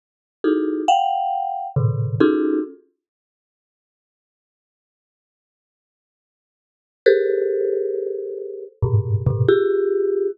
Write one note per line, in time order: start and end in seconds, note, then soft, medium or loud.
0.44 0.84 D#4 soft
0.44 0.84 E4 soft
0.44 0.84 F#4 soft
0.44 0.84 G#4 soft
0.44 0.84 A4 soft
0.88 1.67 F5 medium
0.88 1.67 F#5 medium
0.88 1.67 G5 medium
1.76 2.16 A2 medium
1.76 2.16 A#2 medium
1.76 2.16 C3 medium
1.76 2.16 D3 medium
2.20 2.60 C#4 medium
2.20 2.60 D#4 medium
2.20 2.60 F4 medium
2.20 2.60 F#4 medium
2.20 2.60 G#4 medium
2.20 2.60 A4 medium
7.06 8.65 G4 medium
7.06 8.65 G#4 medium
7.06 8.65 A4 medium
7.06 8.65 A#4 medium
7.06 8.65 C5 medium
8.83 9.22 G2 medium
8.83 9.22 G#2 medium
8.83 9.22 A2 medium
8.83 9.22 B2 medium
9.26 9.46 G#2 medium
9.26 9.46 A#2 medium
9.26 9.46 B2 medium
9.26 9.46 C3 medium
9.49 10.28 F4 loud
9.49 10.28 G4 loud
9.49 10.28 G#4 loud